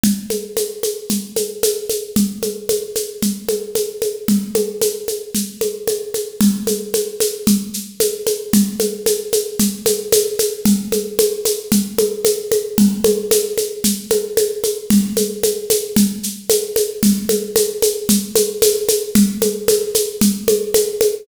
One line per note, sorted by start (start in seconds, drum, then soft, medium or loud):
0.04 low conga loud
0.04 shaker medium
0.30 high conga medium
0.30 shaker medium
0.57 high conga medium
0.57 shaker medium
0.83 high conga medium
0.83 shaker medium
1.10 low conga medium
1.10 shaker medium
1.36 high conga medium
1.36 shaker medium
1.63 high conga loud
1.63 shaker loud
1.89 high conga medium
1.89 shaker medium
2.16 low conga loud
2.16 shaker medium
2.43 high conga medium
2.43 shaker medium
2.69 high conga medium
2.69 shaker medium
2.96 high conga medium
2.96 shaker medium
3.22 low conga medium
3.22 shaker medium
3.49 high conga medium
3.49 shaker medium
3.75 high conga medium
3.75 shaker medium
4.02 high conga medium
4.02 shaker medium
4.28 low conga loud
4.28 shaker medium
4.55 high conga loud
4.55 shaker medium
4.82 high conga loud
4.82 shaker loud
5.08 high conga medium
5.08 shaker medium
5.35 low conga medium
5.35 shaker loud
5.61 high conga medium
5.61 shaker medium
5.87 high conga medium
5.87 shaker medium
6.14 high conga medium
6.14 shaker medium
6.41 low conga loud
6.41 shaker loud
6.67 high conga medium
6.67 shaker medium
6.94 high conga medium
6.94 shaker medium
7.20 high conga medium
7.20 shaker loud
7.47 low conga loud
7.47 shaker loud
7.74 shaker medium
8.00 high conga loud
8.00 shaker loud
8.27 high conga medium
8.27 shaker medium
8.53 low conga loud
8.53 shaker loud
8.80 high conga medium
8.80 shaker medium
9.06 high conga loud
9.06 shaker loud
9.33 high conga loud
9.33 shaker loud
9.59 low conga loud
9.59 shaker loud
9.86 high conga loud
9.86 shaker loud
10.12 high conga loud
10.12 shaker loud
10.39 high conga medium
10.39 shaker loud
10.65 low conga loud
10.65 shaker loud
10.92 high conga medium
10.92 shaker medium
11.19 high conga loud
11.19 shaker loud
11.45 high conga medium
11.45 shaker loud
11.72 low conga loud
11.72 shaker loud
11.98 high conga loud
11.98 shaker medium
12.25 high conga loud
12.25 shaker loud
12.52 high conga loud
12.52 shaker medium
12.78 low conga loud
12.78 shaker medium
13.04 high conga loud
13.04 shaker medium
13.31 high conga loud
13.31 shaker loud
13.58 high conga medium
13.58 shaker medium
13.84 low conga medium
13.84 shaker loud
14.11 high conga loud
14.11 shaker medium
14.37 high conga loud
14.37 shaker medium
14.64 high conga medium
14.64 shaker medium
14.90 low conga loud
14.90 shaker loud
15.17 high conga medium
15.17 shaker loud
15.43 high conga loud
15.43 shaker loud
15.70 high conga loud
15.70 shaker loud
15.96 low conga loud
15.96 shaker loud
16.23 shaker medium
16.50 high conga loud
16.50 shaker loud
16.76 high conga loud
16.76 shaker medium
17.03 low conga loud
17.03 shaker loud
17.29 high conga loud
17.29 shaker medium
17.56 high conga loud
17.56 shaker loud
17.82 high conga loud
17.82 shaker loud
18.09 low conga loud
18.09 shaker loud
18.35 high conga loud
18.35 shaker loud
18.62 high conga loud
18.62 shaker loud
18.88 high conga loud
18.88 shaker loud
19.15 low conga loud
19.15 shaker loud
19.42 high conga loud
19.42 shaker medium
19.68 high conga loud
19.68 shaker loud
19.95 high conga medium
19.95 shaker loud
20.21 low conga loud
20.21 shaker loud
20.48 high conga loud
20.48 shaker medium
20.74 high conga loud
20.74 shaker loud
21.01 high conga loud
21.01 shaker medium